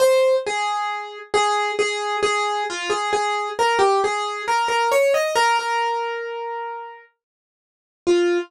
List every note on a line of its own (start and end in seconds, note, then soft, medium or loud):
0.00 0.35 C5 loud
0.46 1.18 G#4 loud
1.34 1.72 G#4 loud
1.79 2.17 G#4 loud
2.23 2.64 G#4 loud
2.70 2.91 F4 loud
2.90 3.11 G#4 loud
3.13 3.49 G#4 loud
3.59 3.80 A#4 loud
3.79 4.00 G4 loud
4.04 4.42 G#4 loud
4.48 4.68 A#4 loud
4.68 4.90 A#4 loud
4.92 5.13 C#5 loud
5.14 5.35 D#5 loud
5.35 5.57 A#4 loud
5.59 7.01 A#4 medium
8.07 8.38 F4 loud